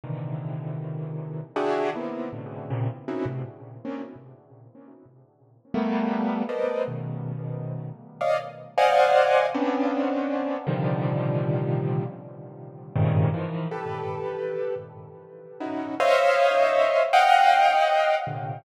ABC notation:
X:1
M:7/8
L:1/16
Q:1/4=79
K:none
V:1 name="Acoustic Grand Piano"
[^A,,C,D,^D,E,]8 [=DE^FG^G]2 [^A,B,CD^DE]2 [=A,,B,,C,^C,=D,]2 | [^A,,C,^C,] z [^A,=C^C^DE^F] [=A,,B,,=C,] z2 [^A,=C^C=D] z7 | z2 [G,A,^A,B,]4 [=A^ABcd^d]2 [B,,^C,^D,]6 | z [^cd^df] z2 [=c=d^df^f^g]4 [B,C^C=D]6 |
[^A,,C,D,^D,F,G,]8 z4 [G,,^G,,A,,C,^C,D,]2 | [^D,E,F,]2 [GAB]6 z4 [^C^DE^F]2 | [c^c^def]6 [df^fg]6 [^A,,=C,=D,]2 |]